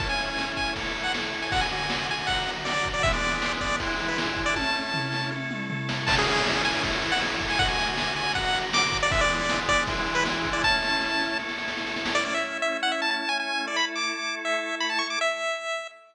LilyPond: <<
  \new Staff \with { instrumentName = "Lead 1 (square)" } { \time 4/4 \key a \major \tempo 4 = 158 a''16 gis''4~ gis''16 gis''8 r8. fis''16 r8. gis''16 | fis''16 gis''4~ gis''16 gis''8 fis''8. r16 d''8. d''16 | e''16 d''4~ d''16 d''8 r8. b'16 r8. d''16 | a''2 r2 |
a''16 gis'4~ gis'16 gis''8 r8. fis''16 r8. gis''16 | fis''16 gis''4~ gis''16 gis''8 fis''8. r16 d'''8. d''16 | e''16 d''4~ d''16 d''8 r8. b'16 r8. d''16 | a''2 r2 |
d''16 d''16 e''8. e''8 fis''16 e''16 a''16 a''8 gis''16 gis''8. | d''16 b''16 r16 d'''4~ d'''16 e''4 b''16 a''16 cis'''16 d'''16 | e''2 r2 | }
  \new Staff \with { instrumentName = "Drawbar Organ" } { \time 4/4 \key a \major <a cis' e'>2 <a e' a'>2 | <d a fis'>2 <d fis fis'>2 | <e gis b d'>2 <e gis d' e'>2 | <a cis' e'>2 <a e' a'>2 |
<a cis' e'>2 <a e' a'>2 | <d a fis'>2 <d fis fis'>2 | <e gis b d'>2 <e gis d' e'>2 | <a cis' e'>2 <a e' a'>2 |
<a cis' e'>1 | <a e' a'>1 | r1 | }
  \new DrumStaff \with { instrumentName = "Drums" } \drummode { \time 4/4 <bd cymr>8 cymr8 sn8 <bd cymr>8 <bd cymr>8 cymr8 sn8 cymr8 | <bd cymr>8 cymr8 sn8 cymr8 <bd cymr>8 cymr8 sn8 <bd cymr>8 | <bd cymr>8 cymr8 sn8 <bd cymr>8 <bd cymr>8 cymr8 sn8 <bd cymr>8 | <bd tommh>4 tomfh8 sn8 tommh8 toml8 tomfh8 sn8 |
<cymc bd>8 cymr8 sn8 cymr8 <bd cymr>8 cymr8 sn8 <bd cymr>8 | <bd cymr>8 cymr8 sn8 cymr8 <bd cymr>8 cymr8 sn8 <bd cymr>8 | <bd cymr>8 cymr8 sn8 <bd cymr>8 <bd cymr>8 cymr8 sn8 <bd cymr>8 | <bd sn>8 sn8 sn8 sn8 sn16 sn16 sn16 sn16 sn16 sn16 sn16 sn16 |
r4 r4 r4 r4 | r4 r4 r4 r4 | r4 r4 r4 r4 | }
>>